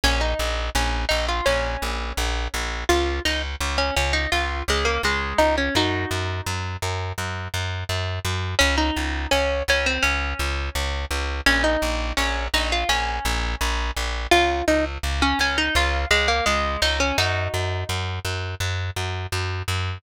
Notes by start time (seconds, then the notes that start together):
0.04 A#1 C#4
0.21 D#4
0.39 A#1
0.75 A#1 C#4
1.09 A#1 D#4
1.29 F4
1.46 A#1 C#4
1.82 A#1
2.17 A#1
2.54 A#1
2.89 C#2 F4
3.25 C#2 D#4
3.61 C#2
3.78 C#4
3.97 C#2 C#4
4.13 D#4
4.32 C#2 F4
4.68 C#2 G#3
4.85 A#3
5.03 C#2 G#3
5.38 C#2 D#4
5.58 C#4
5.75 F#2 D#4 F#4
6.11 F#2
6.46 F#2
6.82 F#2
7.18 F#2
7.54 F#2
7.89 F#2
8.25 F#2
8.59 C#2 C#4
8.78 D#4
8.97 C#2
9.31 C#2 C#4
9.68 C#2 C#4
9.86 C4
10.03 C#2 C#4
10.39 C#2
10.75 C#2
11.11 C#2
11.46 A#1 C#4
11.64 D#4
11.82 A#1
12.17 A#1 C#4
12.54 A#1 D#4
12.72 F4
12.89 A#1 C#4
13.25 A#1
13.61 A#1
13.97 A#1
14.31 C#2 F4
14.68 C#2 D#4
15.03 C#2
15.22 C#4
15.39 C#2 C#4
15.58 D#4
15.75 C#2 F4
16.11 C#2 G#3
16.28 A#3
16.46 C#2 G#3
16.82 C#2 D#4
17.00 C#4
17.18 F#2 D#4 F#4
17.54 F#2
17.89 F#2
18.25 F#2
18.60 F#2
18.96 F#2
19.32 F#2
19.68 F#2